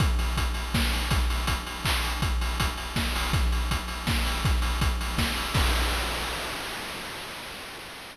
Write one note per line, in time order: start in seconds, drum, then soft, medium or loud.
0.00 kick loud
0.00 closed hi-hat loud
0.19 open hi-hat medium
0.37 kick medium
0.37 closed hi-hat loud
0.54 open hi-hat medium
0.74 kick medium
0.74 snare loud
0.93 open hi-hat medium
1.10 kick loud
1.10 closed hi-hat loud
1.30 open hi-hat medium
1.47 kick medium
1.47 closed hi-hat loud
1.67 open hi-hat medium
1.85 kick medium
1.85 clap loud
2.04 open hi-hat medium
2.22 kick loud
2.22 closed hi-hat loud
2.41 open hi-hat medium
2.60 kick medium
2.60 closed hi-hat loud
2.77 open hi-hat medium
2.96 kick medium
2.96 snare loud
3.16 open hi-hat medium
3.33 kick loud
3.33 closed hi-hat loud
3.52 open hi-hat medium
3.71 kick medium
3.71 closed hi-hat loud
3.88 open hi-hat medium
4.07 kick medium
4.07 snare loud
4.26 open hi-hat medium
4.45 kick loud
4.45 closed hi-hat loud
4.62 open hi-hat medium
4.81 kick loud
4.81 closed hi-hat loud
5.01 open hi-hat medium
5.18 kick medium
5.18 snare loud
5.37 open hi-hat medium
5.54 kick loud
5.54 crash loud